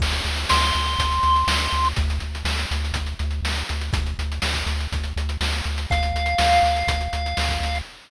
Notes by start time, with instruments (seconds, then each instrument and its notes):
0.00 synth bass 1 D2, kick, crash
0.12 closed hi-hat
0.25 synth bass 1 D2, closed hi-hat
0.36 closed hi-hat
0.49 synth bass 1 D2, lead 1 (square) C6, snare
0.62 snare, closed hi-hat
0.73 synth bass 1 D2, closed hi-hat
0.86 closed hi-hat
0.99 synth bass 1 D2, kick, closed hi-hat
1.12 closed hi-hat
1.23 synth bass 1 D2, closed hi-hat
1.36 closed hi-hat
1.47 synth bass 1 D2, snare
1.59 closed hi-hat
1.73 synth bass 1 D2, closed hi-hat
1.85 closed hi-hat
1.96 synth bass 1 D2, kick, closed hi-hat
2.10 closed hi-hat
2.20 synth bass 1 D2, closed hi-hat
2.35 closed hi-hat
2.45 synth bass 1 D2, snare
2.57 snare, closed hi-hat
2.71 synth bass 1 D2, closed hi-hat
2.85 closed hi-hat
2.93 synth bass 1 D2, kick, closed hi-hat
3.06 closed hi-hat
3.19 synth bass 1 D2, closed hi-hat
3.31 closed hi-hat
3.43 synth bass 1 D2, snare
3.56 closed hi-hat
3.69 synth bass 1 D2, closed hi-hat
3.81 closed hi-hat
3.93 synth bass 1 D2, kick, closed hi-hat
4.06 closed hi-hat
4.19 synth bass 1 D2, closed hi-hat
4.32 closed hi-hat
4.42 synth bass 1 D2, snare
4.54 kick, snare, closed hi-hat
4.66 synth bass 1 D2, closed hi-hat
4.80 closed hi-hat
4.92 synth bass 1 D2, kick, closed hi-hat
5.04 closed hi-hat
5.16 synth bass 1 D2, closed hi-hat
5.29 closed hi-hat
5.41 synth bass 1 D2, snare
5.52 closed hi-hat
5.64 synth bass 1 D2, closed hi-hat
5.78 closed hi-hat
5.90 synth bass 1 D2, lead 1 (square) F5, kick, closed hi-hat
6.03 closed hi-hat
6.14 synth bass 1 D2, closed hi-hat
6.26 closed hi-hat
6.38 synth bass 1 D2, snare
6.50 snare, closed hi-hat
6.63 synth bass 1 D2, closed hi-hat
6.76 closed hi-hat
6.87 synth bass 1 D2, kick, closed hi-hat
7.01 closed hi-hat
7.13 synth bass 1 D2, closed hi-hat
7.26 closed hi-hat
7.37 synth bass 1 D2, snare
7.49 kick, closed hi-hat
7.60 synth bass 1 D2, closed hi-hat
7.75 closed hi-hat